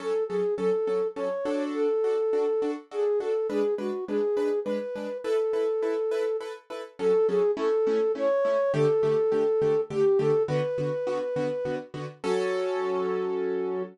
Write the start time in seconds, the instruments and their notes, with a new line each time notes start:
0.00 acoustic grand piano F#3 C#4 A4, flute A4
0.28 acoustic grand piano F#3 C#4 A4, flute G#4
0.58 acoustic grand piano F#3 C#4 A4, flute A4
0.87 acoustic grand piano F#3 C#4 A4
1.16 acoustic grand piano F#3 C#4 A4, flute C#5
1.45 acoustic grand piano D4 F#4 A4
1.74 flute A4
2.04 acoustic grand piano D4 F#4 A4
2.33 acoustic grand piano D4 F#4 A4
2.62 acoustic grand piano D4 F#4 A4
2.91 acoustic grand piano D4 F#4 A4, flute G#4
3.20 acoustic grand piano D4 F#4 A4, flute A4
3.50 acoustic grand piano G#3 D4 B4, flute G#4
3.78 acoustic grand piano G#3 D4 B4, flute F#4
4.08 acoustic grand piano G#3 D4 B4, flute G#4
4.37 acoustic grand piano G#3 D4 B4
4.64 acoustic grand piano G#3 D4 B4, flute B4
4.96 acoustic grand piano G#3 D4 B4
5.24 acoustic grand piano E4 A4 B4, flute A4
5.53 acoustic grand piano E4 A4 B4
5.82 acoustic grand piano E4 A4 B4
6.11 acoustic grand piano E4 A4 B4
6.41 acoustic grand piano E4 A4 B4
6.70 acoustic grand piano E4 A4 B4
6.99 acoustic grand piano F#3 C#4 A4, flute A4
7.28 acoustic grand piano F#3 C#4 A4, flute G#4
7.57 acoustic grand piano A3 C#4 E4, flute A4
7.87 acoustic grand piano A3 C#4 E4
8.15 acoustic grand piano A3 C#4 E4, flute C#5
8.45 acoustic grand piano A3 C#4 E4
8.74 acoustic grand piano D3 A3 G4, flute A4
9.03 acoustic grand piano D3 A3 G4
9.32 acoustic grand piano D3 A3 G4
9.62 acoustic grand piano D3 A3 G4
9.90 acoustic grand piano D3 A3 G4, flute G4
10.19 acoustic grand piano D3 A3 G4, flute A4
10.48 acoustic grand piano D3 B3 F#4, flute B4
10.78 acoustic grand piano D3 B3 F#4
11.07 acoustic grand piano D3 B3 F#4
11.36 acoustic grand piano D3 B3 F#4
11.65 acoustic grand piano D3 B3 F#4
11.94 acoustic grand piano D3 B3 F#4
12.24 acoustic grand piano F#3 C#4 A4, flute F#4